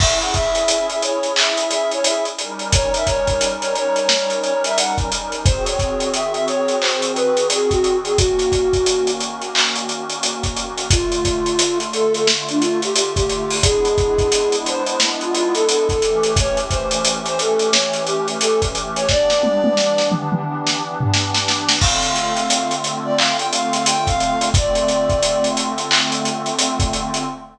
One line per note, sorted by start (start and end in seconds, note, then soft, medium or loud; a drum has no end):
0.00 2.30 C#4 medium
0.00 2.30 E4 medium
0.00 2.30 G#4 medium
0.00 0.19 E5 medium
0.00 kick medium
0.00 crash medium
0.21 0.34 F#5 medium
0.21 closed hi-hat medium
0.34 0.87 E5 medium
0.34 kick medium
0.34 closed hi-hat medium
0.55 closed hi-hat medium
0.68 closed hi-hat medium
0.89 1.02 E5 medium
0.89 closed hi-hat medium
1.02 1.33 C#5 medium
1.02 closed hi-hat medium
1.23 closed hi-hat medium
1.36 1.69 E5 medium
1.36 clap loud
1.57 closed hi-hat medium
1.70 1.90 E5 medium
1.70 snare soft
1.70 closed hi-hat medium
1.91 2.05 C#5 medium
1.91 closed hi-hat medium
2.04 2.24 E5 medium
2.04 closed hi-hat medium
2.25 closed hi-hat medium
2.38 5.42 G3 medium
2.38 5.42 C#4 medium
2.38 5.42 D#4 medium
2.38 5.42 A#4 medium
2.38 closed hi-hat medium
2.59 closed hi-hat medium
2.72 2.93 C#5 medium
2.72 kick medium
2.72 closed hi-hat medium
2.94 3.08 E5 medium
2.94 closed hi-hat medium
3.06 3.49 C#5 medium
3.06 kick medium
3.06 closed hi-hat medium
3.27 kick medium
3.27 closed hi-hat medium
3.41 closed hi-hat medium
3.61 3.74 C#5 medium
3.61 closed hi-hat medium
3.75 4.08 C#5 medium
3.75 closed hi-hat medium
3.96 closed hi-hat medium
4.09 4.38 C#5 medium
4.09 snare medium
4.30 closed hi-hat medium
4.42 4.62 C#5 medium
4.42 closed hi-hat medium
4.64 4.78 E5 medium
4.64 closed hi-hat medium
4.77 4.97 F#5 medium
4.77 closed hi-hat medium
4.98 kick medium
4.98 closed hi-hat medium
5.12 closed hi-hat medium
5.32 closed hi-hat medium
5.45 8.13 D#3 medium
5.45 8.13 C4 medium
5.45 8.13 F#4 medium
5.45 8.13 G#4 medium
5.45 5.65 C5 medium
5.45 kick loud
5.45 closed hi-hat medium
5.66 6.10 C#5 medium
5.66 closed hi-hat medium
5.79 kick medium
5.79 closed hi-hat medium
6.00 closed hi-hat medium
6.14 6.32 E5 medium
6.14 closed hi-hat medium
6.33 6.45 E5 medium
6.33 closed hi-hat soft
6.48 6.79 C#5 medium
6.48 closed hi-hat medium
6.68 closed hi-hat medium
6.80 7.12 C5 medium
6.80 clap medium
7.02 closed hi-hat medium
7.15 7.47 B4 medium
7.15 closed hi-hat medium
7.37 closed hi-hat medium
7.50 7.72 G#4 medium
7.50 closed hi-hat medium
7.70 7.97 F#4 medium
7.70 kick medium
7.70 closed hi-hat medium
7.84 closed hi-hat medium
8.05 8.18 G#4 medium
8.05 closed hi-hat medium
8.17 10.87 D#3 medium
8.17 10.87 A#3 medium
8.17 10.87 C#4 medium
8.17 9.11 F#4 medium
8.17 10.87 F#4 medium
8.17 kick medium
8.17 closed hi-hat medium
8.39 snare soft
8.39 closed hi-hat medium
8.52 kick medium
8.52 closed hi-hat medium
8.73 kick medium
8.73 closed hi-hat medium
8.86 closed hi-hat medium
9.07 closed hi-hat medium
9.20 closed hi-hat medium
9.41 closed hi-hat medium
9.55 clap medium
9.76 closed hi-hat medium
9.89 closed hi-hat medium
10.10 closed hi-hat medium
10.23 closed hi-hat medium
10.43 kick medium
10.43 closed hi-hat medium
10.57 closed hi-hat medium
10.78 closed hi-hat medium
10.90 13.59 D3 medium
10.90 13.59 A3 medium
10.90 13.59 F4 medium
10.90 11.79 F4 medium
10.90 kick medium
10.90 closed hi-hat medium
11.12 closed hi-hat medium
11.25 kick medium
11.25 closed hi-hat medium
11.46 closed hi-hat medium
11.59 closed hi-hat loud
11.80 closed hi-hat medium
11.93 12.13 A4 medium
11.93 closed hi-hat medium
12.14 12.27 A4 medium
12.14 closed hi-hat medium
12.27 snare medium
12.49 12.62 D4 medium
12.49 closed hi-hat medium
12.61 12.81 F4 medium
12.61 closed hi-hat medium
12.82 12.94 G4 medium
12.82 closed hi-hat medium
12.95 13.14 G4 medium
12.95 closed hi-hat medium
13.16 13.56 G4 medium
13.16 kick medium
13.16 closed hi-hat medium
13.29 closed hi-hat medium
13.50 open hi-hat medium
13.62 15.91 G#3 medium
13.62 15.91 B3 medium
13.62 15.91 D4 medium
13.62 15.91 E4 medium
13.62 14.56 G#4 medium
13.62 kick medium
13.62 closed hi-hat loud
13.85 closed hi-hat medium
13.98 kick medium
13.98 closed hi-hat medium
14.18 kick medium
14.18 closed hi-hat medium
14.32 closed hi-hat medium
14.52 closed hi-hat medium
14.66 14.87 C5 medium
14.66 closed hi-hat medium
14.87 15.00 C5 medium
14.87 closed hi-hat medium
15.00 snare medium
15.21 15.34 F4 medium
15.21 closed hi-hat medium
15.35 15.54 F4 medium
15.35 closed hi-hat medium
15.54 15.66 A4 medium
15.54 closed hi-hat medium
15.67 15.87 A4 medium
15.67 closed hi-hat medium
15.89 16.31 A4 medium
15.89 kick medium
15.89 closed hi-hat medium
16.02 19.05 E3 medium
16.02 19.05 A3 medium
16.02 19.05 C#4 medium
16.02 19.05 G4 medium
16.02 closed hi-hat medium
16.23 closed hi-hat medium
16.36 16.58 C#5 medium
16.36 kick medium
16.36 closed hi-hat medium
16.57 closed hi-hat medium
16.70 17.13 C5 medium
16.70 kick medium
16.70 closed hi-hat medium
16.91 closed hi-hat medium
17.05 closed hi-hat medium
17.26 17.40 C5 medium
17.26 closed hi-hat medium
17.39 17.69 A4 medium
17.39 closed hi-hat medium
17.59 snare soft
17.59 closed hi-hat medium
17.72 18.03 C#5 medium
17.72 snare loud
17.93 snare soft
17.93 closed hi-hat medium
18.07 18.28 G4 medium
18.07 closed hi-hat medium
18.28 closed hi-hat medium
18.41 18.61 A4 medium
18.41 closed hi-hat medium
18.62 kick medium
18.62 closed hi-hat medium
18.75 closed hi-hat medium
18.96 19.08 C#5 medium
18.96 closed hi-hat medium
19.09 21.78 E3 medium
19.09 21.78 B3 medium
19.09 21.78 D4 loud
19.09 21.78 G4 medium
19.09 20.08 D5 medium
19.09 kick medium
19.09 snare medium
19.30 snare medium
19.43 high tom medium
19.64 high tom medium
19.77 snare medium
19.98 snare medium
20.12 mid tom medium
20.32 mid tom medium
20.67 snare medium
21.01 floor tom medium
21.13 snare medium
21.34 snare medium
21.48 snare medium
21.69 snare medium
21.80 24.49 D3 medium
21.80 24.49 A3 medium
21.80 24.49 C4 medium
21.80 24.49 F4 medium
21.80 22.76 F5 medium
21.80 kick medium
21.80 crash medium
22.03 closed hi-hat medium
22.16 closed hi-hat medium
22.37 closed hi-hat medium
22.50 closed hi-hat medium
22.71 closed hi-hat medium
22.84 snare soft
22.84 closed hi-hat medium
23.04 23.17 D5 medium
23.17 23.37 F5 medium
23.17 clap medium
23.38 23.51 G5 medium
23.38 closed hi-hat medium
23.53 23.72 F5 medium
23.53 closed hi-hat medium
23.73 23.86 F5 medium
23.73 snare soft
23.73 closed hi-hat medium
23.86 24.08 G5 medium
23.86 closed hi-hat medium
24.07 24.49 F5 medium
24.07 kick medium
24.07 closed hi-hat medium
24.20 closed hi-hat medium
24.41 closed hi-hat medium
24.54 27.23 D3 medium
24.54 27.23 A3 medium
24.54 27.23 C4 medium
24.54 27.23 F4 medium
24.54 25.48 D5 medium
24.54 kick loud
24.54 closed hi-hat medium
24.75 closed hi-hat medium
24.88 closed hi-hat medium
25.10 kick medium
25.10 closed hi-hat medium
25.23 closed hi-hat medium
25.44 closed hi-hat medium
25.57 closed hi-hat medium
25.78 closed hi-hat medium
25.91 clap loud
26.12 closed hi-hat medium
26.25 closed hi-hat medium
26.46 closed hi-hat medium
26.59 closed hi-hat medium
26.80 kick medium
26.80 closed hi-hat medium
26.93 closed hi-hat medium
27.14 closed hi-hat medium